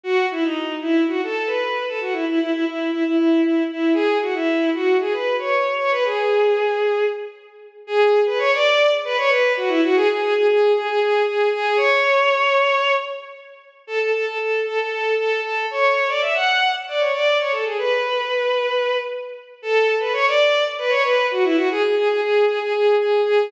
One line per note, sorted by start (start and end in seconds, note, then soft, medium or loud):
0.03 0.26 F#4 loud
0.31 0.43 E4 medium
0.44 0.75 D#4 medium
0.81 1.03 E4 medium
1.08 1.21 F#4 medium
1.23 1.48 A4 medium
1.46 1.83 B4 medium
1.87 1.99 A4 medium
2.01 2.13 F#4 medium
2.12 2.25 E4 medium
2.27 2.39 E4 medium
2.39 2.51 E4 medium
2.52 2.64 E4 medium
2.65 2.90 E4 medium
2.91 3.03 E4 medium
3.04 3.16 E4 medium
3.16 3.41 E4 medium
3.42 3.63 E4 medium
3.71 3.93 E4 medium
3.94 4.18 G#4 loud
4.22 4.34 F#4 medium
4.34 4.70 E4 medium
4.74 4.97 F#4 medium
5.00 5.13 G#4 medium
5.12 5.35 B4 medium
5.38 5.74 C#5 medium
5.78 5.90 C#5 medium
5.91 6.04 B4 loud
6.05 7.05 G#4 medium
7.87 8.20 G#4 loud
8.26 8.38 B4 medium
8.38 8.51 C#5 loud
8.54 8.91 D5 loud
9.04 9.17 B4 loud
9.17 9.30 C#5 loud
9.29 9.53 B4 loud
9.57 9.69 F#4 medium
9.68 9.80 E4 loud
9.83 9.95 F#4 loud
9.95 10.08 G#4 loud
10.09 10.21 G#4 medium
10.21 10.34 G#4 loud
10.34 10.47 G#4 loud
10.48 10.72 G#4 loud
10.74 10.87 G#4 medium
10.87 10.99 G#4 loud
11.00 11.22 G#4 loud
11.26 11.49 G#4 medium
11.53 11.77 G#4 loud
11.77 12.92 C#5 loud
13.87 13.99 A4 loud
13.99 14.12 A4 medium
14.13 14.25 A4 medium
14.26 14.38 A4 medium
14.39 14.60 A4 medium
14.66 14.78 A4 medium
14.79 14.90 A4 medium
14.90 15.14 A4 medium
15.17 15.40 A4 medium
15.42 15.66 A4 medium
15.71 16.08 C#5 medium
16.08 16.21 D5 medium
16.21 16.33 E5 medium
16.34 16.70 F#5 medium
16.88 17.01 D5 medium
16.99 17.12 C#5 medium
17.13 17.38 D5 medium
17.39 17.52 C#5 medium
17.52 17.64 A4 medium
17.65 17.77 G#4 medium
17.78 18.97 B4 medium
19.62 19.95 A4 loud
20.00 20.12 B4 medium
20.13 20.25 C#5 loud
20.27 20.64 D5 loud
20.78 20.91 B4 loud
20.89 21.02 C#5 loud
21.03 21.26 B4 loud
21.31 21.43 F#4 medium
21.44 21.56 E4 loud
21.56 21.68 F#4 loud
21.71 21.82 G#4 loud
21.82 21.95 G#4 medium
21.96 22.08 G#4 loud
22.09 22.20 G#4 medium
22.21 22.45 G#4 medium
22.47 22.59 G#4 medium
22.62 22.73 G#4 loud
22.73 22.95 G#4 medium
22.99 23.21 G#4 medium
23.25 23.50 G#4 loud